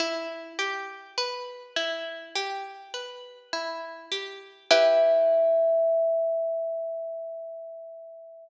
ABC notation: X:1
M:4/4
L:1/8
Q:1/4=51
K:Em
V:1 name="Kalimba"
z8 | e8 |]
V:2 name="Pizzicato Strings"
E G B E G B E G | [EGB]8 |]